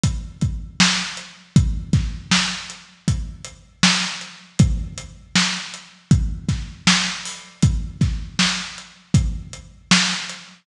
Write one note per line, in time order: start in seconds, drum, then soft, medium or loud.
0.03 kick medium
0.03 closed hi-hat medium
0.41 kick medium
0.41 closed hi-hat medium
0.80 snare medium
1.17 closed hi-hat medium
1.56 kick medium
1.56 closed hi-hat medium
1.93 kick medium
1.93 snare soft
1.93 closed hi-hat medium
2.31 snare medium
2.70 closed hi-hat medium
3.08 kick medium
3.08 closed hi-hat medium
3.44 closed hi-hat medium
3.83 snare loud
4.21 closed hi-hat medium
4.59 kick medium
4.59 closed hi-hat medium
4.98 closed hi-hat medium
5.35 snare medium
5.74 closed hi-hat medium
6.11 kick medium
6.11 closed hi-hat medium
6.49 kick medium
6.49 snare soft
6.49 closed hi-hat medium
6.87 snare medium
7.25 open hi-hat medium
7.63 kick medium
7.63 closed hi-hat medium
8.01 kick medium
8.01 snare soft
8.01 closed hi-hat medium
8.39 snare medium
8.78 closed hi-hat medium
9.14 kick medium
9.14 closed hi-hat medium
9.53 closed hi-hat medium
9.91 snare loud
10.29 closed hi-hat medium